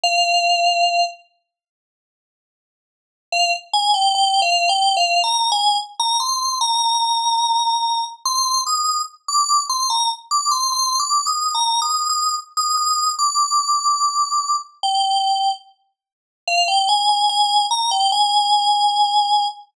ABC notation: X:1
M:4/4
L:1/16
Q:1/4=73
K:Fdor
V:1 name="Electric Piano 2"
f6 z10 | f z a g (3g2 f2 g2 (3f2 b2 a2 z b c'2 | b8 c'2 e'2 z d'2 c' | b z d' c' (3c'2 d'2 e'2 (3b2 e'2 e'2 z e' e'2 |
d'8 g4 z4 | f g a a a2 b g a8 |]